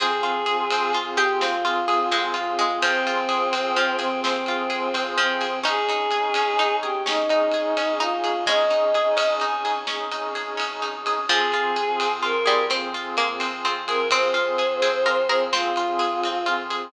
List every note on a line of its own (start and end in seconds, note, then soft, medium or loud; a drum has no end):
0.00 0.21 F2 loud
0.00 0.21 C4 medium
0.00 5.59 C4 medium
0.00 5.59 F4 medium
0.00 1.00 G#4 medium
0.00 5.59 G#4 medium
0.00 0.96 G#4 loud
0.00 kick loud
0.00 ride medium
0.22 0.42 F2 medium
0.22 0.44 F4 medium
0.22 ride medium
0.46 0.68 F2 medium
0.46 0.67 G#4 medium
0.46 ride medium
0.70 0.92 F2 medium
0.70 0.93 C4 medium
0.70 ride loud
0.93 1.15 F2 medium
0.93 1.16 F4 medium
0.93 ride medium
1.17 1.38 F2 medium
1.17 1.38 G4 medium
1.17 1.41 G4 loud
1.17 1.38 G#4 medium
1.17 ride medium
1.41 1.62 F2 medium
1.41 1.63 C4 medium
1.41 2.22 F4 loud
1.41 snare loud
1.64 1.84 F2 medium
1.64 1.86 F4 medium
1.64 ride medium
1.88 2.09 F2 medium
1.88 2.09 G#4 medium
1.88 ride medium
2.11 2.31 F2 medium
2.11 2.53 G#3 medium
2.11 2.33 C4 medium
2.11 ride medium
2.34 2.55 F2 medium
2.34 2.55 F4 medium
2.34 2.79 F4 medium
2.34 ride medium
2.58 2.78 F2 medium
2.58 2.78 G#3 medium
2.58 2.80 G#4 medium
2.58 ride medium
2.82 3.03 F2 medium
2.82 3.74 F3 medium
2.82 3.96 C4 loud
2.82 3.03 C4 medium
2.82 kick loud
2.82 ride loud
3.06 3.26 F2 medium
3.06 3.28 F4 medium
3.06 ride medium
3.29 3.49 F2 medium
3.29 3.50 G#4 medium
3.29 ride medium
3.53 3.73 F2 medium
3.53 3.74 C4 medium
3.53 ride loud
3.76 3.97 F2 medium
3.76 4.16 F3 medium
3.76 3.99 F4 medium
3.76 ride medium
3.99 4.20 F2 loud
3.99 4.21 C4 loud
3.99 4.20 G#4 medium
3.99 ride medium
4.22 4.44 F2 medium
4.22 5.03 C4 loud
4.22 4.45 C4 medium
4.22 snare loud
4.46 4.67 F2 medium
4.46 4.70 F4 medium
4.46 ride medium
4.70 4.90 F2 medium
4.70 4.91 G#4 medium
4.70 ride medium
4.94 5.14 F2 medium
4.94 5.15 C4 medium
4.94 ride medium
5.17 5.37 F2 medium
5.17 5.60 F3 medium
5.17 5.59 C4 loud
5.17 5.39 F4 medium
5.17 ride medium
5.41 5.63 F2 medium
5.41 5.62 G#4 medium
5.41 ride medium
5.63 5.85 G#1 medium
5.63 5.85 C#4 medium
5.63 11.24 C#4 medium
5.63 11.24 D#4 medium
5.63 6.47 D#4 medium
5.63 6.76 G#4 loud
5.63 11.24 G#4 medium
5.63 kick loud
5.63 ride loud
5.88 6.08 G#1 medium
5.88 6.11 D#4 medium
5.88 ride medium
6.11 6.31 G#1 medium
6.11 6.33 G#4 medium
6.11 ride medium
6.34 6.57 G#1 medium
6.34 6.56 C#4 medium
6.34 ride loud
6.59 6.79 G#1 medium
6.59 7.04 D#4 medium
6.59 6.81 D#4 medium
6.59 ride medium
6.82 7.02 G#1 medium
6.82 7.03 G4 loud
6.82 7.04 G#4 medium
7.05 7.25 G#1 medium
7.05 7.27 C#4 medium
7.05 7.96 D#4 loud
7.05 snare loud
7.28 7.48 G#1 medium
7.28 7.51 D#4 medium
7.28 ride medium
7.52 7.73 G#1 medium
7.52 7.75 G#4 medium
7.52 ride medium
7.77 7.97 G#1 loud
7.77 7.98 C#4 medium
7.77 ride medium
8.00 8.21 G#1 medium
8.00 8.39 D#4 medium
8.00 8.22 D#4 medium
8.00 8.44 F4 loud
8.00 ride medium
8.24 8.44 G#1 medium
8.24 8.45 G#4 medium
8.24 ride medium
8.46 8.67 G#1 medium
8.46 10.02 G#3 medium
8.46 8.70 C#4 medium
8.46 9.34 D#5 loud
8.46 kick loud
8.46 ride medium
8.70 8.92 G#1 medium
8.70 8.92 D#4 medium
8.70 ride medium
8.94 9.14 G#1 medium
8.94 9.16 G#4 medium
8.94 ride medium
9.17 9.37 G#1 medium
9.17 9.38 C#4 medium
9.17 ride loud
9.40 9.62 G#1 medium
9.40 9.62 D#4 medium
9.40 9.79 G#5 loud
9.40 ride medium
9.64 9.84 G#1 medium
9.64 9.86 G#4 medium
9.64 ride medium
9.87 10.08 G#1 medium
9.87 10.09 C#4 medium
9.87 snare loud
10.10 10.30 G#1 medium
10.10 10.33 D#4 medium
10.10 ride medium
10.35 10.55 G#1 medium
10.35 10.56 G#4 medium
10.35 ride medium
10.57 10.80 G#1 medium
10.57 10.79 C#4 medium
10.57 ride loud
10.82 11.02 G#1 loud
10.82 11.03 D#4 medium
10.82 ride medium
11.06 11.26 G#1 medium
11.06 11.28 G#4 medium
11.06 ride medium
11.29 11.49 F2 loud
11.29 12.35 F3 medium
11.29 16.88 C4 medium
11.29 11.50 C4 medium
11.29 16.88 F4 medium
11.29 12.12 G#4 loud
11.29 16.88 G#4 medium
11.29 kick loud
11.29 ride medium
11.51 11.71 F2 loud
11.51 11.75 F4 medium
11.51 ride medium
11.76 11.96 F2 medium
11.76 11.97 G#4 medium
11.76 ride medium
12.00 12.20 F2 medium
12.00 12.22 C4 medium
12.00 ride loud
12.23 12.44 F2 medium
12.23 12.44 F4 medium
12.23 12.65 A#4 loud
12.23 ride medium
12.46 12.68 F2 medium
12.46 12.70 G3 medium
12.46 12.67 G#4 medium
12.46 ride medium
12.70 12.92 F2 medium
12.70 13.14 C4 medium
12.70 12.92 C4 medium
12.70 snare medium
12.93 13.13 F2 medium
12.93 13.16 F4 medium
12.93 ride medium
13.17 13.37 F2 medium
13.17 13.56 A#3 medium
13.17 13.39 G#4 medium
13.17 ride medium
13.40 13.61 F2 medium
13.40 13.61 C4 medium
13.40 ride medium
13.64 13.84 F2 medium
13.64 14.11 C4 medium
13.64 13.86 F4 medium
13.64 ride medium
13.87 14.07 F2 medium
13.87 14.10 G#4 medium
13.87 14.08 A#4 loud
13.87 ride medium
14.11 14.31 F2 medium
14.11 14.33 C4 medium
14.11 14.74 C4 loud
14.11 15.44 C5 loud
14.11 kick loud
14.11 ride loud
14.34 14.56 F2 medium
14.34 14.55 F4 medium
14.34 ride medium
14.58 14.78 F2 medium
14.58 14.80 G#4 medium
14.58 ride medium
14.82 15.03 F2 loud
14.82 15.03 C4 medium
14.82 15.04 G#4 medium
14.82 ride medium
15.05 15.25 F2 medium
15.05 15.27 F4 medium
15.05 15.26 A#4 medium
15.05 ride medium
15.29 15.49 F2 medium
15.29 15.50 G#4 medium
15.29 15.50 A#4 medium
15.29 ride medium
15.52 15.72 F2 loud
15.52 15.74 C4 medium
15.52 16.78 C4 medium
15.52 16.49 F4 loud
15.52 snare loud
15.76 15.97 F2 medium
15.76 15.98 F4 medium
15.76 ride medium
15.99 16.21 F2 medium
15.99 16.20 G#4 medium
15.99 ride medium
16.23 16.43 F2 medium
16.23 16.46 C4 medium
16.23 ride medium
16.46 16.68 F2 medium
16.46 16.67 F4 medium
16.46 ride medium
16.70 16.90 F2 medium
16.70 16.91 G#4 medium
16.70 ride medium